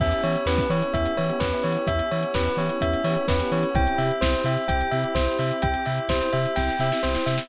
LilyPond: <<
  \new Staff \with { instrumentName = "Tubular Bells" } { \time 4/4 \key e \minor \tempo 4 = 128 e''8 cis''8 b'8 cis''8 e''8 cis''8 b'8 cis''8 | e''8 cis''8 b'8 cis''8 e''8 cis''8 b'8 cis''8 | g''8 e''8 c''8 e''8 g''8 e''8 c''8 e''8 | g''8 e''8 c''8 e''8 g''8 e''8 c''8 e''8 | }
  \new Staff \with { instrumentName = "Electric Piano 1" } { \time 4/4 \key e \minor <b cis' e' g'>4 <b cis' e' g'>8 <b cis' e' g'>8 <b cis' e' g'>8 <b cis' e' g'>16 <b cis' e' g'>16 <b cis' e' g'>16 <b cis' e' g'>8.~ | <b cis' e' g'>4 <b cis' e' g'>8 <b cis' e' g'>8 <b cis' e' g'>8 <b cis' e' g'>16 <b cis' e' g'>16 <b cis' e' g'>16 <b cis' e' g'>8. | <c' e' g'>4 <c' e' g'>8 <c' e' g'>8 <c' e' g'>8 <c' e' g'>16 <c' e' g'>16 <c' e' g'>16 <c' e' g'>8.~ | <c' e' g'>4 <c' e' g'>8 <c' e' g'>8 <c' e' g'>8 <c' e' g'>16 <c' e' g'>16 <c' e' g'>16 <c' e' g'>8. | }
  \new Staff \with { instrumentName = "Synth Bass 2" } { \clef bass \time 4/4 \key e \minor e,8 e8 e,8 e8 e,8 e8 e,8 e8 | e,8 e8 e,8 e8 e,8 e8 e,8 e8 | c,8 c8 c,8 c8 c,8 c8 c,8 c8 | c,8 c8 c,8 c8 c,8 c8 c,8 c8 | }
  \new Staff \with { instrumentName = "Pad 5 (bowed)" } { \time 4/4 \key e \minor <b cis' e' g'>1~ | <b cis' e' g'>1 | <c' e' g'>1~ | <c' e' g'>1 | }
  \new DrumStaff \with { instrumentName = "Drums" } \drummode { \time 4/4 <cymc bd>16 hh16 hho16 hh16 sn16 <hh bd>16 hho16 hh16 <hh bd>16 hh16 hho16 hh16 <bd sn>16 hh16 hho16 hh16 | <hh bd>16 hh16 hho16 hh16 <bd sn>16 hh16 hho16 hh16 <hh bd>16 hh16 hho16 hh16 <bd sn>16 hh16 hho16 hh16 | <hh bd>16 hh16 hho16 hh16 <bd sn>16 hh16 hho16 hh16 <hh bd>16 hh16 hho16 hh16 <bd sn>16 hh16 hho16 hh16 | <hh bd>16 hh16 hho16 hh16 <bd sn>16 hh16 hho16 hh16 <bd sn>16 sn16 sn16 sn16 sn16 sn16 sn16 sn16 | }
>>